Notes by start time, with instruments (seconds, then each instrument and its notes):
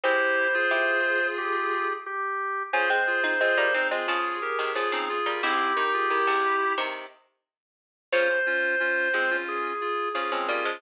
0.04 harpsichord G#3 C4, clarinet E4 G4, drawbar organ C5
0.54 clarinet F4 G#4
0.71 harpsichord E4 G4
1.38 drawbar organ G4
2.06 drawbar organ G4
2.73 harpsichord C#4 F4, clarinet F4 G#4, drawbar organ C5
2.90 harpsichord G#3 C4
3.07 clarinet F4 G#4
3.24 harpsichord C4 D#4
3.41 harpsichord G#3 C4, clarinet F4 G#4
3.57 harpsichord G3 A#3
3.74 harpsichord G#3 C4, clarinet C4 D#4
3.91 harpsichord G#3 C4, clarinet F4 G#4
4.08 harpsichord C#3 F3, drawbar organ G#4
4.42 clarinet G4 A#4
4.59 harpsichord C3 D#3
4.75 harpsichord C#3 F3, clarinet F4 G#4, drawbar organ G#4
4.92 harpsichord C#3 F3, clarinet C4 D#4
5.09 clarinet F4 G#4
5.26 harpsichord G3 A#3
5.43 harpsichord G#2 C3, clarinet C4 E4, drawbar organ G4
5.77 harpsichord D#3, clarinet D#4
5.93 clarinet F4 G#4
6.10 harpsichord D#3, clarinet E4 G4
6.27 harpsichord G#2 C3
6.78 harpsichord C3 D#3
8.12 harpsichord C#3 F3, clarinet C#4 F4, drawbar organ C5
8.46 clarinet C#4 F4
8.80 clarinet C#4 F4
9.13 harpsichord F3 G#3, clarinet G#3 C4
9.30 clarinet C#4 F4
9.49 drawbar organ G#4
9.81 clarinet F4 G#4
10.14 harpsichord C#3 F3, clarinet C#4 F4, drawbar organ G#4
10.32 harpsichord C#3 F3, clarinet G#3 C4
10.48 harpsichord G3 A#3, clarinet C#4 F4
10.65 harpsichord F3 G#3